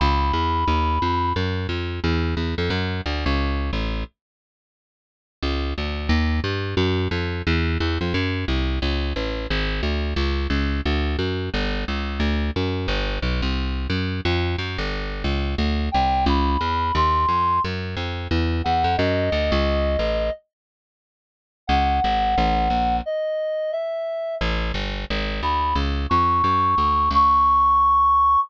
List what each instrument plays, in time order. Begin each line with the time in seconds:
0.00 electric bass (finger) C#2, clarinet B5
0.33 electric bass (finger) E2
0.68 electric bass (finger) D#2
1.02 electric bass (finger) F2
1.36 electric bass (finger) F#2
1.69 electric bass (finger) F2
2.04 electric bass (finger) E2
2.37 electric bass (finger) E2
2.58 electric bass (finger) F2
2.70 electric bass (finger) F#2
3.06 electric bass (finger) D2
3.26 electric bass (finger) C#2
3.73 electric bass (finger) A1
5.43 electric bass (finger) C#2
5.78 electric bass (finger) D2
6.09 electric bass (finger) D#2
6.44 electric bass (finger) G2
6.77 electric bass (finger) F#2
7.11 electric bass (finger) F2
7.47 electric bass (finger) E2
7.80 electric bass (finger) E2
8.01 electric bass (finger) F2
8.14 electric bass (finger) F#2
8.48 electric bass (finger) C2
8.82 electric bass (finger) C#2
9.16 electric bass (finger) A1
9.50 electric bass (finger) G#1
9.83 electric bass (finger) D2
10.16 electric bass (finger) C#2
10.50 electric bass (finger) C#2
10.85 electric bass (finger) D2
11.19 electric bass (finger) F#2
11.54 electric bass (finger) G1
11.88 electric bass (finger) C#2
12.20 electric bass (finger) D2
12.56 electric bass (finger) F#2
12.88 electric bass (finger) G1
13.22 electric bass (finger) B1
13.42 electric bass (finger) C2
13.90 electric bass (finger) F#2
14.25 electric bass (finger) F2
14.58 electric bass (finger) F#2
14.78 electric bass (finger) G1
15.24 electric bass (finger) C#2
15.58 electric bass (finger) D2
15.92 electric bass (finger) C2, clarinet G5
16.26 electric bass (finger) C#2, clarinet B5
16.61 electric bass (finger) E2
16.95 electric bass (finger) D#2, clarinet C6
17.28 electric bass (finger) F2
17.64 electric bass (finger) F#2
17.97 electric bass (finger) F2
18.31 electric bass (finger) E2
18.64 electric bass (finger) E2, clarinet F#5
18.84 electric bass (finger) F2
18.97 electric bass (finger) F#2, clarinet D#5
19.32 electric bass (finger) D2
19.52 electric bass (finger) C#2
19.99 electric bass (finger) A1
21.67 electric bass (finger) C#2, clarinet F#5
22.04 electric bass (finger) G#1
22.38 electric bass (finger) A1
22.70 electric bass (finger) A#1
23.06 clarinet D#5
23.72 clarinet E5
24.41 electric bass (finger) A1
24.74 electric bass (finger) G1
25.10 electric bass (finger) G#1
25.43 electric bass (finger) D2, clarinet B5
25.75 electric bass (finger) C#2
26.10 electric bass (finger) F2, clarinet C#6
26.44 electric bass (finger) F#2
26.78 electric bass (finger) D2
27.11 electric bass (finger) C#2, clarinet C#6